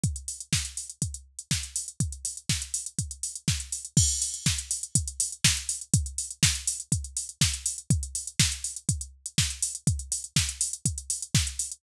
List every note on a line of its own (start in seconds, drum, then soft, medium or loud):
0.03 kick loud
0.03 closed hi-hat medium
0.16 closed hi-hat medium
0.28 open hi-hat medium
0.40 closed hi-hat medium
0.53 kick medium
0.53 snare loud
0.65 closed hi-hat medium
0.77 open hi-hat medium
0.90 closed hi-hat medium
1.02 kick medium
1.02 closed hi-hat medium
1.14 closed hi-hat medium
1.39 closed hi-hat medium
1.51 kick medium
1.51 snare medium
1.63 closed hi-hat medium
1.76 open hi-hat medium
1.88 closed hi-hat medium
2.00 kick medium
2.00 closed hi-hat medium
2.12 closed hi-hat medium
2.25 open hi-hat medium
2.37 closed hi-hat medium
2.49 kick medium
2.49 snare loud
2.62 closed hi-hat medium
2.74 open hi-hat medium
2.86 closed hi-hat medium
2.99 kick medium
2.99 closed hi-hat medium
3.11 closed hi-hat medium
3.23 open hi-hat medium
3.35 closed hi-hat medium
3.48 kick medium
3.48 snare medium
3.60 closed hi-hat medium
3.72 open hi-hat medium
3.85 closed hi-hat medium
3.97 kick loud
3.97 crash loud
4.09 closed hi-hat medium
4.22 open hi-hat medium
4.34 closed hi-hat medium
4.46 kick medium
4.46 snare loud
4.58 closed hi-hat medium
4.71 open hi-hat medium
4.83 closed hi-hat medium
4.95 kick medium
4.95 closed hi-hat loud
5.07 closed hi-hat medium
5.20 open hi-hat loud
5.32 closed hi-hat medium
5.44 kick medium
5.44 snare loud
5.57 closed hi-hat medium
5.69 open hi-hat medium
5.81 closed hi-hat medium
5.94 kick loud
5.94 closed hi-hat loud
6.06 closed hi-hat medium
6.18 open hi-hat medium
6.31 closed hi-hat medium
6.43 kick loud
6.43 snare loud
6.55 closed hi-hat medium
6.67 open hi-hat medium
6.80 closed hi-hat medium
6.92 kick medium
6.92 closed hi-hat loud
7.04 closed hi-hat medium
7.17 open hi-hat medium
7.29 closed hi-hat medium
7.41 kick loud
7.41 snare loud
7.54 closed hi-hat medium
7.66 open hi-hat medium
7.78 closed hi-hat medium
7.90 kick loud
7.90 closed hi-hat loud
8.03 closed hi-hat medium
8.15 open hi-hat medium
8.27 closed hi-hat medium
8.39 kick medium
8.39 snare loud
8.52 closed hi-hat medium
8.64 open hi-hat medium
8.76 closed hi-hat medium
8.89 kick medium
8.89 closed hi-hat loud
9.01 closed hi-hat medium
9.26 closed hi-hat medium
9.38 kick medium
9.38 snare loud
9.50 closed hi-hat medium
9.62 open hi-hat medium
9.75 closed hi-hat medium
9.87 kick loud
9.87 closed hi-hat loud
9.99 closed hi-hat medium
10.12 open hi-hat medium
10.24 closed hi-hat medium
10.36 kick medium
10.36 snare loud
10.49 closed hi-hat medium
10.61 open hi-hat loud
10.73 closed hi-hat medium
10.85 kick medium
10.85 closed hi-hat loud
10.98 closed hi-hat medium
11.10 open hi-hat medium
11.22 closed hi-hat medium
11.35 kick loud
11.35 snare loud
11.47 closed hi-hat medium
11.59 open hi-hat medium
11.72 closed hi-hat medium